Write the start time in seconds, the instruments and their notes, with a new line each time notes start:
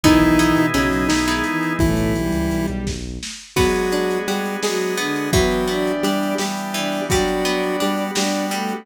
0.04 synth bass 1 B1, lead 1 (square) D#3 D#4, violin E3 E4, drawbar organ B3 D#4 E4 G#4, pizzicato strings B3 D#4 E4 G#4, kick, closed hi-hat
0.21 synth bass 1 B1, closed hi-hat
0.39 pizzicato strings B3 D#4 E4 G#4, closed hi-hat
0.56 synth bass 1 B2, closed hi-hat
0.74 synth bass 1 B1, lead 1 (square) C#3 C#4, violin F#3 F#4, pizzicato strings B3 D#4 E4 G#4, closed hi-hat
0.92 synth bass 1 B1, closed hi-hat
1.08 synth bass 1 B1, lead 1 (square) D#3 D#4, snare
1.28 violin G#3 G#4, pizzicato strings B3 D#4 E4 G#4, closed hi-hat
1.44 violin E3 E4, closed hi-hat
1.63 closed hi-hat
1.79 synth bass 1 B1, violin A2 A3, lead 1 (square) E3 E4, kick, closed hi-hat
1.97 synth bass 1 B1, closed hi-hat
2.15 violin G3 G4, closed hi-hat
2.32 synth bass 1 C#2, closed hi-hat
2.51 synth bass 1 B1, closed hi-hat
2.67 synth bass 1 B1, closed hi-hat
2.86 synth bass 1 B1, kick, snare
3.23 snare
3.56 lead 1 (square) F#3 F#4, violin G#3 G#4, pizzicato strings B3, drawbar organ B3 D4 F#4 G#4, kick, crash
3.75 closed hi-hat
3.92 pizzicato strings D4, closed hi-hat
4.11 closed hi-hat
4.28 lead 1 (square) G3 G4, pizzicato strings F#4, closed hi-hat
4.46 closed hi-hat
4.63 violin F#3 F#4, lead 1 (square) G#3 G#4, pizzicato strings G#4, snare
4.81 closed hi-hat
4.97 violin D3 D4, pizzicato strings B3, closed hi-hat
5.16 closed hi-hat
5.33 pizzicato strings E3, drawbar organ E3 B3 D4 G4, lead 1 (square) F#3 F#4, violin B3 B4, kick, closed hi-hat
5.51 closed hi-hat
5.67 pizzicato strings B3, violin D4 D5, closed hi-hat
5.87 closed hi-hat
6.03 lead 1 (square) G3 G4, pizzicato strings D4, closed hi-hat
6.23 closed hi-hat
6.38 lead 1 (square) G3 G4, pizzicato strings G4, snare
6.57 closed hi-hat
6.74 pizzicato strings E3, violin D4 D5, closed hi-hat
6.92 open hi-hat
7.09 lead 1 (square) F#3 F#4, drawbar organ G3 B3 D4 F#4, pizzicato strings G3, violin D4 D5, kick, closed hi-hat
7.28 closed hi-hat
7.45 pizzicato strings B3, closed hi-hat
7.63 closed hi-hat
7.80 lead 1 (square) G3 G4, pizzicato strings D4, closed hi-hat
7.97 closed hi-hat
8.15 lead 1 (square) G3 G4, violin D4 D5, pizzicato strings F#4, snare
8.32 closed hi-hat
8.51 pizzicato strings G3, violin A3 A4, closed hi-hat
8.69 closed hi-hat